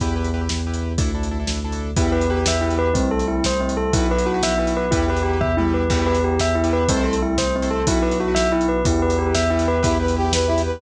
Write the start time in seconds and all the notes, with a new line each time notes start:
0.00 E2 E4 G4 B4, kick, closed hi-hat
0.16 E4 G4 B4
0.24 closed hi-hat
0.34 E4 G4 B4
0.41 E4 G4 B4
0.49 E2, snare
0.67 E4 G4 B4
0.74 closed hi-hat
0.98 D2 D4 E4 A4, kick, closed hi-hat
1.15 D4 E4 A4
1.23 closed hi-hat
1.31 D4 E4 A4
1.40 D4 E4 A4
1.47 D2, snare
1.64 D4 E4 A4
1.72 closed hi-hat
1.96 E2 B3 E4 G4 B4, kick, closed hi-hat
2.12 E4 G4 B4
2.21 closed hi-hat
2.30 E4 G4 B4
2.37 E4 G4 B4
2.46 E2 E5, snare
2.61 E4 G4 B4
2.70 closed hi-hat
2.79 B4
2.94 C2 A3 C4 E4, kick, closed hi-hat
3.11 A4
3.19 closed hi-hat
3.28 E4
3.44 C2 C5, snare
3.60 C4
3.69 closed hi-hat
3.77 A4
3.93 B1 B3 E4 F#4 B4, kick, closed hi-hat
4.09 E4 F#4 B4
4.18 closed hi-hat
4.26 E4 F#4 B4
4.34 E4 F#4 B4
4.43 B1 E5, snare
4.58 E4 F#4 B4
4.67 closed hi-hat
4.77 B4
4.91 E2 B3 E4 G4 B4, kick, closed hi-hat
5.08 E4 G4 B4
5.17 closed hi-hat
5.23 E4 G4 B4
5.33 E4 G4 B4
5.41 E2 E5, kick, floor tom
5.57 E4 G4 B4, mid tom
5.74 B4
5.90 E2 B3 E4 G4 B4, kick, crash
6.06 B4
6.15 closed hi-hat
6.24 G4
6.39 E2 E5, snare
6.55 E4
6.64 E4 G4 B4, closed hi-hat
6.73 B4
6.88 C2 A3 C4 E4 A4 C5, kick, closed hi-hat
7.04 A4
7.13 closed hi-hat
7.22 E4
7.37 C2 C5, snare
7.56 C4
7.62 E4 A4 C5, closed hi-hat
7.71 A4
7.87 B1 B3 E4 F#4 B4, kick, closed hi-hat
8.02 E4 F#4 B4
8.11 closed hi-hat
8.20 E4 F#4 B4
8.28 E4 F#4 B4
8.35 B1 E5, snare
8.52 E4 F#4 B4
8.61 closed hi-hat
8.69 B4
8.85 E2 B3 E4 G4 B4, kick, closed hi-hat
9.01 E4 G4 B4
9.10 closed hi-hat
9.18 E4 G4 B4
9.26 E4 G4 B4
9.35 E2 E5, snare
9.50 E4 G4 B4
9.59 closed hi-hat
9.68 B4
9.83 E2 B3 E4 G4 B4, kick, closed hi-hat
10.00 E4 G4 B4
10.08 closed hi-hat
10.16 E4 G4 B4
10.25 E4 G4 B4
10.33 E2 B4, snare
10.47 E4 G4 B4
10.58 closed hi-hat
10.66 B4